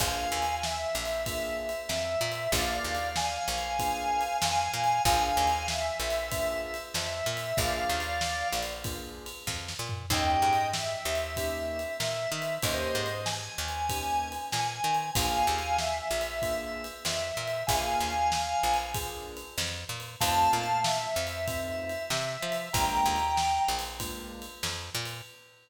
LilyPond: <<
  \new Staff \with { instrumentName = "Drawbar Organ" } { \time 4/4 \key bes \major \tempo 4 = 95 <f'' aes''>4 e''2 e''4 | <d'' f''>4 <f'' aes''>2 <f'' aes''>4 | <f'' aes''>4 e''2 e''4 | <d'' f''>4. r2 r8 |
<ees'' g''>4 e''2 fes''4 | <c'' ees''>4 aes''2 aes''4 | <f'' aes''>4 e''2 e''4 | <f'' aes''>2 r2 |
<f'' a''>4 e''2 e''4 | <g'' bes''>4. r2 r8 | }
  \new Staff \with { instrumentName = "Acoustic Grand Piano" } { \time 4/4 \key bes \major <bes d' f' aes'>2 <bes d' f' aes'>2 | <bes d' f' aes'>2 <bes d' f' aes'>2 | <bes d' f' aes'>2 <bes d' f' aes'>2 | <bes d' f' aes'>2 <bes d' f' aes'>2 |
<bes des' ees' g'>2 <bes des' ees' g'>2 | <bes des' ees' g'>2 <bes des' ees' g'>2 | <bes d' f' aes'>2 <bes d' f' aes'>2 | <bes d' f' aes'>2 <bes d' f' aes'>2 |
<a c' ees' f'>2 <a c' ees' f'>2 | <aes bes d' f'>2 <aes bes d' f'>2 | }
  \new Staff \with { instrumentName = "Electric Bass (finger)" } { \clef bass \time 4/4 \key bes \major bes,,8 ees,4 bes,,4. f,8 bes,8 | bes,,8 ees,4 bes,,4. f,8 bes,8 | bes,,8 ees,4 bes,,4. f,8 bes,8 | bes,,8 ees,4 bes,,4. f,8 bes,8 |
ees,8 aes,4 ees,4. bes,8 ees8 | ees,8 aes,4 ees,4. bes,8 ees8 | bes,,8 ees,4 bes,,4. f,8 bes,8 | bes,,8 ees,4 bes,,4. f,8 bes,8 |
f,8 bes,4 f,4. c8 f8 | bes,,8 ees,4 bes,,4. f,8 bes,8 | }
  \new DrumStaff \with { instrumentName = "Drums" } \drummode { \time 4/4 \tuplet 3/2 { <bd cymr>8 r8 cymr8 sn8 r8 cymr8 <bd cymr>8 r8 cymr8 sn8 r8 cymr8 } | \tuplet 3/2 { <bd cymr>8 r8 cymr8 sn8 r8 cymr8 <bd cymr>8 r8 cymr8 sn8 r8 cymr8 } | \tuplet 3/2 { <bd cymr>8 r8 cymr8 sn8 r8 cymr8 <bd cymr>8 r8 cymr8 sn8 r8 cymr8 } | \tuplet 3/2 { <bd cymr>8 r8 cymr8 sn8 r8 cymr8 <bd cymr>8 r8 cymr8 <bd sn>8 sn8 tomfh8 } |
\tuplet 3/2 { <cymc bd>8 r8 cymr8 sn8 r8 cymr8 <bd cymr>8 r8 cymr8 sn8 r8 cymr8 } | \tuplet 3/2 { <bd cymr>8 r8 cymr8 sn8 r8 cymr8 <bd cymr>8 r8 cymr8 sn8 r8 cymr8 } | \tuplet 3/2 { <bd cymr>8 r8 cymr8 sn8 r8 cymr8 <bd cymr>8 r8 cymr8 sn8 r8 cymr8 } | \tuplet 3/2 { <bd cymr>8 r8 cymr8 sn8 r8 cymr8 <bd cymr>8 r8 cymr8 sn8 r8 cymr8 } |
\tuplet 3/2 { <bd cymr>8 r8 cymr8 sn8 r8 cymr8 <bd cymr>8 r8 cymr8 sn8 r8 cymr8 } | \tuplet 3/2 { <bd cymr>8 r8 cymr8 sn8 r8 cymr8 <bd cymr>8 r8 cymr8 sn8 r8 cymr8 } | }
>>